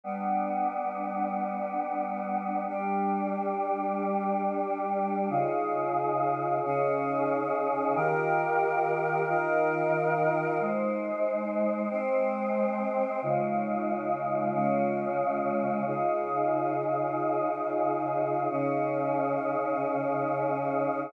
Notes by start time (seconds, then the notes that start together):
0.04 G3 B3 D4
2.68 G3 D4 G4
5.29 C#3 D#4 F4 G#4
6.64 C#3 C#4 D#4 G#4
7.95 D#3 F4 G4 A#4
9.28 D#3 D#4 F4 A#4
10.60 G#3 D#4 C5
11.90 G#3 C4 C5
13.22 C#3 G#3 D#4 F4
14.53 C#3 G#3 C#4 F4
15.86 C#3 D#4 F4 G#4
18.50 C#3 C#4 D#4 G#4